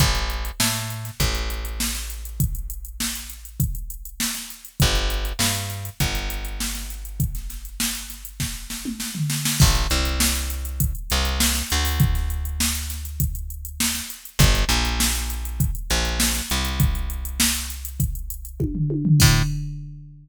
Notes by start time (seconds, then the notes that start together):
0.00 A1, kick, closed hi-hat
0.15 closed hi-hat
0.30 closed hi-hat
0.45 closed hi-hat
0.60 A2, snare
0.75 closed hi-hat
0.90 closed hi-hat
1.05 snare, closed hi-hat
1.20 A1, kick, closed hi-hat
1.35 closed hi-hat
1.50 closed hi-hat
1.65 closed hi-hat
1.80 snare
1.95 snare, closed hi-hat
2.10 closed hi-hat
2.25 closed hi-hat
2.40 kick, closed hi-hat
2.55 closed hi-hat
2.70 closed hi-hat
2.85 closed hi-hat
3.00 snare
3.15 closed hi-hat
3.30 closed hi-hat
3.45 closed hi-hat
3.60 kick, closed hi-hat
3.75 closed hi-hat
3.90 closed hi-hat
4.05 closed hi-hat
4.20 snare
4.35 snare, closed hi-hat
4.50 closed hi-hat
4.65 closed hi-hat
4.80 G1, kick, closed hi-hat
4.95 closed hi-hat
5.10 closed hi-hat
5.25 closed hi-hat
5.39 G2, snare
5.55 closed hi-hat
5.70 snare, closed hi-hat
5.85 closed hi-hat
6.00 G1, kick, closed hi-hat
6.15 closed hi-hat
6.30 closed hi-hat
6.45 closed hi-hat
6.60 snare
6.75 snare, closed hi-hat
6.90 closed hi-hat
7.05 closed hi-hat
7.20 kick, closed hi-hat
7.35 snare, closed hi-hat
7.50 snare, closed hi-hat
7.65 closed hi-hat
7.80 snare
7.95 closed hi-hat
8.10 snare, closed hi-hat
8.25 closed hi-hat
8.40 kick, snare
8.70 snare
8.85 mid tom
9.00 snare
9.15 floor tom
9.30 snare
9.45 snare
9.60 A1, kick, crash
9.75 closed hi-hat
9.90 C2, closed hi-hat
10.05 closed hi-hat
10.20 snare
10.35 closed hi-hat
10.50 closed hi-hat
10.65 closed hi-hat
10.80 kick, closed hi-hat
10.95 closed hi-hat
11.10 C2, snare, closed hi-hat
11.25 closed hi-hat
11.40 snare
11.55 snare, closed hi-hat
11.70 D2, snare, closed hi-hat
11.85 open hi-hat
12.00 kick, closed hi-hat
12.15 snare, closed hi-hat
12.30 closed hi-hat
12.45 closed hi-hat
12.60 snare
12.75 closed hi-hat
12.90 snare, closed hi-hat
13.05 closed hi-hat
13.20 kick, closed hi-hat
13.35 closed hi-hat
13.50 closed hi-hat
13.65 closed hi-hat
13.80 snare
13.95 snare, closed hi-hat
14.10 closed hi-hat
14.25 closed hi-hat
14.39 G1, kick, closed hi-hat
14.55 closed hi-hat
14.69 A#1, closed hi-hat
14.85 closed hi-hat
15.00 snare
15.15 closed hi-hat
15.30 closed hi-hat
15.45 closed hi-hat
15.60 kick, closed hi-hat
15.75 closed hi-hat
15.90 A#1, closed hi-hat
16.05 closed hi-hat
16.20 snare
16.35 snare, closed hi-hat
16.50 C2, closed hi-hat
16.65 closed hi-hat
16.80 kick, closed hi-hat
16.95 closed hi-hat
17.10 closed hi-hat
17.25 closed hi-hat
17.40 snare
17.55 closed hi-hat
17.70 closed hi-hat
17.85 closed hi-hat
18.00 kick, closed hi-hat
18.15 closed hi-hat
18.30 closed hi-hat
18.45 closed hi-hat
18.60 kick, high tom
18.75 floor tom
18.90 high tom
19.05 floor tom
19.20 A2, kick, crash